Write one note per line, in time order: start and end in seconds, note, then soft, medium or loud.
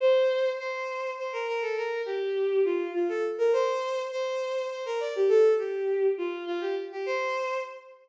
0.00 0.50 C5 loud
0.59 1.11 C5 loud
1.18 1.32 C5 medium
1.33 1.47 A#4 loud
1.47 1.61 A#4 loud
1.61 1.75 A4 medium
1.77 2.01 A#4 loud
2.06 2.61 G4 medium
2.65 2.91 F4 medium
2.94 3.08 F4 medium
3.09 3.23 A4 medium
3.38 3.52 A#4 loud
3.53 4.02 C5 loud
4.12 4.68 C5 loud
4.70 4.84 C5 medium
4.86 5.00 A#4 loud
5.00 5.14 D5 loud
5.16 5.30 G4 medium
5.29 5.53 A4 loud
5.58 6.07 G4 medium
6.18 6.43 F4 loud
6.47 6.61 F4 loud
6.61 6.75 G4 loud
6.92 7.06 G4 medium
7.06 7.57 C5 loud